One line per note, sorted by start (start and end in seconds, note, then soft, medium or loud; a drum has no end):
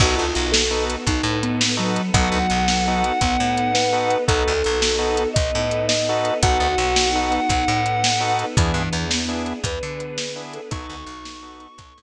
0.00 0.15 B1 loud
0.00 1.07 B3 medium
0.00 0.26 B3 medium
0.00 1.07 D#4 medium
0.00 0.26 D#4 medium
0.00 1.07 F#4 medium
0.00 0.26 F#4 medium
0.00 0.17 F#4 medium
0.00 1.07 A4 medium
0.00 0.26 A4 medium
0.00 kick loud
0.00 crash loud
0.16 0.34 D2 medium
0.16 0.32 F4 medium
0.34 0.97 B1 medium
0.34 0.49 F4 medium
0.34 closed hi-hat medium
0.52 0.85 A4 medium
0.52 snare loud
0.71 0.96 B3 medium
0.71 0.96 D#4 medium
0.71 0.96 F#4 medium
0.71 0.96 A4 medium
0.90 closed hi-hat loud
1.07 1.22 B1 medium
1.07 2.13 B3 medium
1.07 2.13 D#4 medium
1.07 1.39 D#4 medium
1.07 2.13 A4 medium
1.07 2.14 B4 medium
1.07 kick loud
1.07 closed hi-hat loud
1.23 1.99 A2 loud
1.43 1.75 B3 medium
1.43 closed hi-hat medium
1.61 snare loud
1.77 2.10 F#3 medium
1.77 2.02 B3 medium
1.77 2.02 D#4 medium
1.77 2.02 F#4 medium
1.77 2.02 A4 medium
1.96 closed hi-hat medium
2.14 2.29 B1 loud
2.14 3.02 F#3 medium
2.14 3.20 B3 medium
2.14 2.39 B3 medium
2.14 3.20 D#4 medium
2.14 2.39 D#4 medium
2.14 3.20 F#4 medium
2.14 2.39 F#4 medium
2.14 3.20 A4 medium
2.14 2.39 A4 medium
2.14 4.12 F#5 medium
2.14 kick loud
2.14 closed hi-hat loud
2.32 2.47 D2 medium
2.50 3.11 B1 medium
2.50 closed hi-hat medium
2.68 snare loud
2.88 3.13 B3 medium
2.88 3.13 D#4 medium
2.88 3.13 F#4 medium
2.88 3.13 A4 medium
3.04 closed hi-hat medium
3.21 3.37 B1 medium
3.21 4.28 B3 medium
3.21 3.71 B3 medium
3.21 4.28 D#4 medium
3.21 4.28 A4 medium
3.21 4.28 B4 medium
3.21 kick loud
3.21 closed hi-hat loud
3.40 4.16 A2 medium
3.57 closed hi-hat medium
3.74 4.24 B4 medium
3.74 snare loud
3.93 4.18 B3 medium
3.93 4.18 D#4 medium
3.93 4.18 F#4 medium
3.93 4.18 A4 medium
4.10 closed hi-hat medium
4.28 4.44 B1 loud
4.28 4.53 B3 medium
4.28 5.35 B3 medium
4.28 4.53 D#4 medium
4.28 5.35 D#4 medium
4.28 4.53 F#4 medium
4.28 5.35 F#4 medium
4.28 4.53 A4 medium
4.28 5.28 A4 medium
4.28 5.35 A4 medium
4.28 kick loud
4.28 closed hi-hat loud
4.48 4.63 D2 medium
4.64 5.27 B1 loud
4.64 closed hi-hat medium
4.82 snare loud
4.98 5.23 B3 medium
4.98 5.23 D#4 medium
4.98 5.23 F#4 medium
4.98 5.23 A4 medium
5.17 closed hi-hat loud
5.34 5.51 B1 medium
5.34 6.42 B3 medium
5.34 6.42 D#4 medium
5.34 6.42 A4 medium
5.34 6.42 B4 medium
5.34 5.86 D#5 medium
5.34 kick loud
5.34 closed hi-hat loud
5.55 6.31 A2 medium
5.71 closed hi-hat medium
5.88 6.37 D#5 medium
5.88 snare loud
6.09 6.34 B3 medium
6.09 6.34 D#4 medium
6.09 6.34 F#4 medium
6.09 6.34 A4 medium
6.25 closed hi-hat medium
6.42 6.58 B1 loud
6.42 6.68 B3 medium
6.42 7.49 B3 medium
6.42 6.68 D#4 medium
6.42 7.49 D#4 medium
6.42 6.68 F#4 medium
6.42 7.10 F#4 medium
6.42 7.50 F#4 medium
6.42 6.68 A4 medium
6.42 7.49 A4 medium
6.42 8.37 F#5 medium
6.42 kick loud
6.42 closed hi-hat loud
6.60 6.75 D2 medium
6.78 7.39 B1 loud
6.78 closed hi-hat medium
6.96 snare loud
7.12 7.40 B3 medium
7.12 7.80 D#4 medium
7.12 7.40 D#4 medium
7.12 7.40 F#4 medium
7.12 7.40 A4 medium
7.32 closed hi-hat medium
7.49 7.65 B1 medium
7.49 8.56 B3 medium
7.49 8.56 D#4 medium
7.49 8.56 A4 medium
7.49 8.56 B4 medium
7.49 kick loud
7.49 closed hi-hat loud
7.68 8.44 A2 loud
7.86 closed hi-hat medium
8.04 snare loud
8.20 8.45 B3 medium
8.20 8.45 D#4 medium
8.20 8.45 F#4 medium
8.20 8.45 A4 medium
8.39 closed hi-hat medium
8.57 8.72 E2 loud
8.57 8.75 E3 medium
8.57 9.63 B3 medium
8.57 8.83 B3 medium
8.57 9.63 D4 medium
8.57 8.83 D4 medium
8.57 9.63 E4 medium
8.57 8.83 E4 medium
8.57 9.63 G#4 medium
8.57 8.83 G#4 medium
8.57 kick loud
8.57 closed hi-hat loud
8.74 8.89 G2 medium
8.74 9.05 E3 medium
8.93 9.53 E2 loud
8.93 closed hi-hat medium
9.10 9.59 B3 medium
9.10 snare loud
9.28 9.53 B3 medium
9.28 9.53 D4 medium
9.28 9.53 E4 medium
9.28 9.53 G#4 medium
9.46 closed hi-hat medium
9.64 9.79 E2 loud
9.64 10.70 B3 medium
9.64 10.70 D4 medium
9.64 10.70 G#4 medium
9.64 10.70 B4 medium
9.64 10.42 B4 medium
9.64 kick loud
9.64 closed hi-hat loud
9.83 10.59 D3 medium
10.00 closed hi-hat medium
10.18 snare loud
10.36 10.61 B3 medium
10.36 10.61 D4 medium
10.36 10.61 E4 medium
10.36 10.61 G#4 medium
10.53 10.70 A4 medium
10.53 closed hi-hat medium
10.70 10.87 B1 loud
10.70 11.76 B3 medium
10.70 10.96 B3 medium
10.70 11.76 D#4 medium
10.70 10.96 D#4 medium
10.70 11.66 D#4 medium
10.70 11.76 F#4 medium
10.70 10.96 F#4 medium
10.70 11.76 A4 medium
10.70 10.96 A4 medium
10.70 12.02 C#6 medium
10.70 kick loud
10.70 closed hi-hat loud
10.90 11.05 D2 loud
11.06 11.67 B1 loud
11.06 closed hi-hat medium
11.25 snare loud
11.42 11.67 B3 medium
11.42 11.67 D#4 medium
11.42 11.67 F#4 medium
11.42 11.67 A4 medium
11.60 closed hi-hat medium
11.77 11.93 B1 medium
11.77 12.02 B3 medium
11.77 12.02 D#4 medium
11.77 12.02 A4 medium
11.77 12.02 B4 medium
11.77 kick loud
11.77 closed hi-hat loud
11.98 12.02 A2 medium